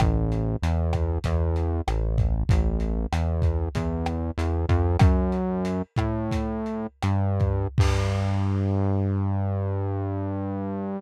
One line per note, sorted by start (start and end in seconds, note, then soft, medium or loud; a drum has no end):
0.00 0.56 A1 loud
0.00 kick loud
0.00 cross-stick loud
0.00 closed hi-hat loud
0.32 closed hi-hat medium
0.62 1.19 E2 medium
0.62 closed hi-hat loud
0.93 kick medium
0.93 cross-stick medium
0.93 closed hi-hat medium
1.24 1.81 E2 loud
1.24 kick medium
1.24 closed hi-hat loud
1.56 closed hi-hat medium
1.88 2.44 A1 medium
1.88 cross-stick loud
1.88 closed hi-hat loud
2.18 kick medium
2.18 closed hi-hat medium
2.49 3.06 A1 loud
2.49 kick loud
2.49 closed hi-hat loud
2.80 closed hi-hat medium
3.12 3.69 E2 medium
3.12 cross-stick loud
3.12 closed hi-hat loud
3.42 kick medium
3.42 closed hi-hat medium
3.75 4.31 E2 medium
3.75 kick medium
3.75 closed hi-hat loud
4.06 cross-stick loud
4.06 closed hi-hat medium
4.38 4.66 E2 loud
4.38 closed hi-hat loud
4.69 4.97 F2 loud
4.69 kick medium
4.69 closed hi-hat medium
4.99 5.82 F#2 loud
4.99 kick loud
4.99 cross-stick loud
4.99 closed hi-hat loud
5.32 closed hi-hat medium
5.65 closed hi-hat loud
5.96 6.87 A2 medium
5.96 kick medium
5.96 cross-stick medium
5.96 closed hi-hat medium
6.31 kick medium
6.31 closed hi-hat loud
6.66 closed hi-hat medium
7.03 7.67 G2 loud
7.03 cross-stick medium
7.03 closed hi-hat loud
7.40 kick medium
7.40 closed hi-hat medium
7.78 10.99 G2 medium
7.78 kick loud
7.78 crash loud